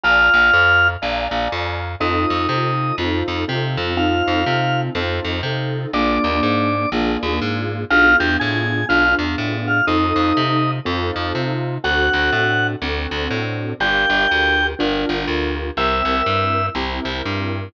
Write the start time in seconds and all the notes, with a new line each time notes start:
0.03 A#1 F4 D5 F5 G#5 A#5
0.34 A#1
0.53 F2
1.02 A#1 D5 F5 G#5 A#5
1.31 A#1
1.52 F2
2.00 F2 C4 D#4 F4 A4 D#5
2.30 F2
2.49 C3 C4 D#4 F4 A4
2.98 F2 C4 D#4 F4 A4
3.28 F2
3.48 C3 C4 D#4 F4 A4
3.77 F2
3.97 C4 D#4 F4 A4 F5
4.27 F2
4.46 C3 C4 D#4 F4 A4
4.95 F2 C4 D#4 F4 A4
5.24 F2
5.43 C3 C4 D#4 F4 A4
5.93 A#1 A#3 D4 F4 G#4 D5
6.24 D#2
6.43 G#2
6.92 A#1 A#3 D4 F4 G#4
7.23 D#2
7.42 G#2
7.90 B1 B3 D4 F4 G#4 F5
8.20 E2 G4 G5
8.40 A2 G#4 G#5
8.89 B1 B3 D4 F4 G#4 F5
9.19 E2
9.38 A2
9.67 F4 F5
9.87 F2 C4 D#4 F4 A4 D#5
10.16 F2
10.37 C3
10.85 F2 C4 D#4 F4 A4
11.16 F2
11.35 C3
11.84 D2 C4 D4 F#4 A4 F#5
12.13 D2
12.32 A2
12.82 D2 C4 D4 F#4 A4
13.11 D2
13.30 A2
13.80 G1 D4 F4 G4 A#4 G5
14.10 G1
14.31 D2
14.79 G1 D4 F4 G4 A#4
15.09 G1
15.27 D2
15.77 C2 C4 E4 G4 A#4 E5
16.05 C2
16.26 G2
16.75 C2 C4 E4 G4 A#4
17.05 C2
17.25 G2